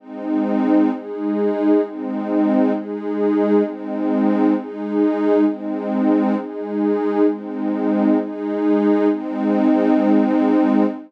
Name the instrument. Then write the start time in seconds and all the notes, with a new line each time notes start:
pad 5 (bowed)
0.00 G#3 C4 D#4
0.91 G#3 D#4 G#4
1.82 G#3 C4 D#4
2.73 G#3 D#4 G#4
3.64 G#3 C4 D#4
4.55 G#3 D#4 G#4
5.46 G#3 C4 D#4
6.36 G#3 D#4 G#4
7.27 G#3 C4 D#4
8.18 G#3 D#4 G#4
9.09 G#3 C4 D#4